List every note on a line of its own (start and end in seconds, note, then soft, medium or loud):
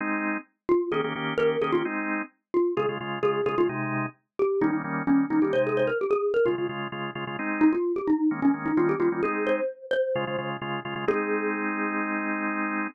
0.00 0.37 G#3 loud
0.00 0.37 C4 loud
0.00 0.37 D#4 loud
0.69 0.89 F4 medium
0.92 1.01 D#3 loud
0.92 1.01 A#3 loud
0.92 1.01 C#4 loud
0.92 1.01 G4 loud
0.92 1.03 G#4 medium
1.04 1.13 D#3 medium
1.04 1.13 A#3 medium
1.04 1.13 C#4 medium
1.04 1.13 G4 medium
1.15 1.34 D#3 medium
1.15 1.34 A#3 medium
1.15 1.34 C#4 medium
1.15 1.34 G4 medium
1.38 1.57 D#3 medium
1.38 1.57 A#3 medium
1.38 1.57 C#4 medium
1.38 1.57 G4 medium
1.38 1.60 A#4 medium
1.62 1.71 D#3 medium
1.62 1.71 A#3 medium
1.62 1.71 C#4 medium
1.62 1.71 G4 medium
1.62 1.72 G#4 medium
1.72 1.83 D#3 medium
1.72 1.83 A#3 medium
1.72 1.83 C#4 medium
1.72 1.83 F4 medium
1.72 1.83 G4 medium
1.85 2.22 G#3 medium
1.85 2.22 C4 loud
1.85 2.22 D#4 loud
2.54 2.75 F4 medium
2.77 2.86 C#3 loud
2.77 2.86 G#3 medium
2.77 2.86 F4 loud
2.77 2.88 G#4 medium
2.89 2.98 C#3 medium
2.89 2.98 G#3 medium
2.89 2.98 F4 medium
3.00 3.19 C#3 medium
3.00 3.19 G#3 medium
3.00 3.19 F4 medium
3.23 3.41 C#3 medium
3.23 3.41 G#3 medium
3.23 3.41 F4 medium
3.23 3.42 G#4 medium
3.46 3.55 C#3 medium
3.46 3.55 G#3 medium
3.46 3.55 F4 medium
3.46 3.57 G#4 medium
3.58 3.67 C#3 medium
3.58 3.67 G#3 medium
3.58 3.69 F4 medium
3.58 3.67 F4 medium
3.69 4.06 C3 loud
3.69 4.06 G#3 loud
3.69 4.06 D#4 loud
4.39 4.60 G4 medium
4.61 4.71 D#3 loud
4.61 4.71 G3 loud
4.61 4.71 A#3 medium
4.61 4.71 C#4 loud
4.61 4.72 D#4 medium
4.73 4.82 D#3 medium
4.73 4.82 G3 medium
4.73 4.82 A#3 medium
4.73 4.82 C#4 medium
4.84 5.03 D#3 medium
4.84 5.03 G3 medium
4.84 5.03 A#3 medium
4.84 5.03 C#4 medium
5.07 5.26 D#3 medium
5.07 5.26 G3 medium
5.07 5.26 A#3 medium
5.07 5.27 C#4 medium
5.07 5.26 C#4 medium
5.30 5.40 D#3 medium
5.30 5.40 G3 medium
5.30 5.40 A#3 medium
5.30 5.40 C#4 medium
5.30 5.41 D#4 medium
5.42 5.52 D#3 medium
5.42 5.52 G3 medium
5.42 5.52 A#3 medium
5.42 5.52 C#4 medium
5.42 5.53 G4 medium
5.53 5.90 C3 medium
5.53 5.90 G#3 loud
5.53 5.90 D#4 loud
5.53 5.64 C5 medium
5.67 5.78 G#4 medium
5.77 5.88 C5 medium
5.87 5.98 A#4 medium
6.01 6.12 G4 medium
6.11 6.29 G#4 medium
6.34 6.45 A#4 medium
6.46 6.55 C#3 loud
6.46 6.55 G#3 medium
6.46 6.65 F4 medium
6.46 6.55 F4 loud
6.58 6.67 C#3 medium
6.58 6.67 G#3 medium
6.58 6.67 F4 medium
6.69 6.88 C#3 medium
6.69 6.88 G#3 medium
6.69 6.88 F4 medium
6.92 7.11 C#3 medium
6.92 7.11 G#3 medium
6.92 7.11 F4 medium
7.15 7.25 C#3 medium
7.15 7.25 G#3 medium
7.15 7.25 F4 medium
7.27 7.36 C#3 medium
7.27 7.36 G#3 medium
7.27 7.36 F4 medium
7.39 7.76 G#3 medium
7.39 7.76 C4 loud
7.39 7.76 D#4 loud
7.61 7.72 D#4 medium
7.73 7.93 F4 medium
7.96 8.07 G4 medium
8.07 8.27 D#4 medium
8.31 8.40 D#3 medium
8.31 8.40 G#3 loud
8.31 8.40 A#3 loud
8.31 8.40 C#4 medium
8.42 8.51 D#3 medium
8.42 8.51 G#3 medium
8.42 8.51 A#3 medium
8.42 8.51 C#4 medium
8.42 8.53 C#4 medium
8.54 8.72 D#3 medium
8.54 8.72 G#3 medium
8.54 8.72 A#3 medium
8.54 8.72 C#4 medium
8.66 8.77 D#4 medium
8.77 8.96 D#3 loud
8.77 8.96 G3 medium
8.77 8.96 A#3 loud
8.77 8.96 C#4 loud
8.77 8.88 F4 medium
8.89 9.00 G4 medium
9.00 9.09 D#3 medium
9.00 9.09 G3 medium
9.00 9.09 A#3 medium
9.00 9.09 C#4 medium
9.00 9.21 F4 medium
9.12 9.21 D#3 medium
9.12 9.21 G3 medium
9.12 9.21 A#3 medium
9.12 9.21 C#4 medium
9.23 9.61 G#3 loud
9.23 9.61 C4 loud
9.23 9.61 D#4 loud
9.23 9.44 G#4 medium
9.47 9.84 C5 medium
9.91 10.47 C5 medium
10.15 10.25 C#3 loud
10.15 10.25 G#3 medium
10.15 10.25 F4 loud
10.27 10.37 C#3 medium
10.27 10.37 G#3 medium
10.27 10.37 F4 medium
10.38 10.57 C#3 medium
10.38 10.57 G#3 medium
10.38 10.57 F4 medium
10.62 10.80 C#3 medium
10.62 10.80 G#3 medium
10.62 10.80 F4 medium
10.85 10.94 C#3 medium
10.85 10.94 G#3 medium
10.85 10.94 F4 loud
10.96 11.05 C#3 medium
10.96 11.05 G#3 medium
10.96 11.05 F4 medium
11.08 12.87 G#3 loud
11.08 12.87 C4 loud
11.08 12.87 D#4 loud
11.08 12.88 G#4 loud